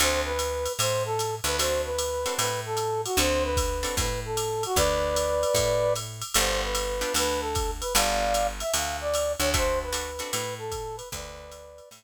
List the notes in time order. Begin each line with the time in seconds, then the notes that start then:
0.00 D2 C4 D4 F#4 A4 C5, ride
0.25 B4
0.39 hi-hat pedal, ride
0.66 ride
0.79 A2 C5, ride
1.05 A4
1.19 hi-hat pedal, ride
1.44 D2 B4, ride
1.59 C4 D4 F#4 A4 C5, ride
1.85 B4
1.98 hi-hat pedal, ride
2.26 C4 D4 F#4 A4, ride
2.38 A2 B4, ride
2.66 A4
2.77 hi-hat pedal, ride
3.05 F#4, ride
3.17 D2 C4 D4 F#4 A4 C5, ride
3.44 B4
3.57 kick, hi-hat pedal, ride
3.83 C4 D4 F#4 A4, ride
3.97 A2 B4, kick, ride
4.25 A4
4.37 hi-hat pedal, ride
4.63 F#4, ride
4.76 D2 B4 D5, kick, ride
5.16 hi-hat pedal, ride
5.43 ride
5.54 A2, kick, ride
5.96 hi-hat pedal, ride
6.22 ride
6.34 G1 B3 D4 F4 G4 C5, ride
6.64 B4
6.75 hi-hat pedal, ride
7.01 B3 D4 F4 G4, ride
7.14 D2 B4, ride
7.40 A4
7.55 kick, hi-hat pedal, ride
7.81 B4, ride
7.95 G1 B3 D4 F4 G4 D5 F5, ride
8.34 hi-hat pedal, ride
8.60 E5, ride
8.74 D2 F5, ride
9.01 D5
9.14 hi-hat pedal, ride
9.39 D2 C#5, ride
9.54 A3 C4 D4 F#4 C5, kick, ride
9.83 B4
9.93 A3 C4 D4 F#4, hi-hat pedal, ride
10.19 A3 C4 D4 F#4, ride
10.31 A2 B4, ride
10.58 A4
10.72 kick, hi-hat pedal, ride
10.96 B4, ride
11.12 D2 B4 D5, kick, ride
11.52 hi-hat pedal, ride
11.78 ride
11.91 A2, ride